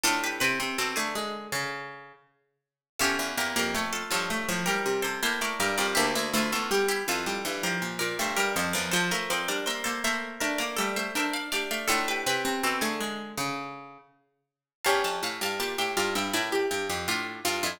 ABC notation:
X:1
M:4/4
L:1/16
Q:1/4=81
K:Dm
V:1 name="Pizzicato Strings"
[FA] [G=B] [GB]10 z4 | [FA] z [GB] [GB] [A^c] [FA] [Ac]3 [GB]2 [A=c] [Ac] [Bd] [Bd] [Bd] | [EG] z [FA] [FA] [GB] [EG] [FA]3 [GB]2 [Bd] [Ac] [GB] [Ac] [Bd] | [Ac] z [Bd] [Bd] [ce] [Ac] [ce]3 [Bd]2 [ce] [ce] [df] [df] [df] |
[FA] [G=B] [GB]10 z4 | [fa] [fa] [fa] [fa] [fa] [eg] [df] [eg] [Bd]4 [DF]2 [DF] [DF] |]
V:2 name="Pizzicato Strings"
A2 =B2 A ^G7 z4 | G6 F6 E4 | D E E14 | c B c2 c z A2 B2 A2 B2 G2 |
A2 =B2 A ^G7 z4 | ^C16 |]
V:3 name="Pizzicato Strings"
D2 C C C A, ^G,2 ^C,4 z4 | ^C2 B, B, A,2 F, A, F, G,3 B, A, G, G, | B,2 A, A, G,2 E, G, E, F,3 A, G, F, F, | F, A, C D B, B, B,2 D B, G,2 D2 D2 |
D2 C C C A, ^G,2 ^C,4 z4 | G4 G G F E E G G G F2 F E |]
V:4 name="Pizzicato Strings"
A,,2 C, C, =B,, D,7 z4 | E,, E,, E,, F,,3 G,,2 A,,2 C, C, A,,2 G,, F,, | D,, D,, D,, E,,3 F,,2 G,,2 B,, B,, G,,2 F,, E,, | F, F, F, G,3 A,2 A,2 A, A, A,2 A, A, |
A,,2 C, C, =B,, D,7 z4 | E,, F,, A,, G,, B,, A,, G,, G,, A,,2 G,, F,, A,,2 G,, F,, |]